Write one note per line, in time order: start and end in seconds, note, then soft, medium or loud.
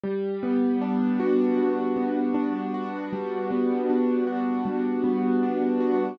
0.04 1.56 G3 loud
0.43 1.96 B3 medium
0.81 2.34 D4 medium
1.20 2.74 F#4 medium
1.57 3.12 G3 medium
1.96 3.50 B3 medium
2.34 3.89 D4 medium
2.74 4.27 F#4 medium
3.13 4.65 G3 loud
3.51 5.03 B3 medium
3.90 5.42 D4 medium
4.27 5.80 F#4 medium
4.65 6.11 G3 medium
5.04 6.13 B3 medium
5.43 6.16 D4 medium
5.80 6.17 F#4 medium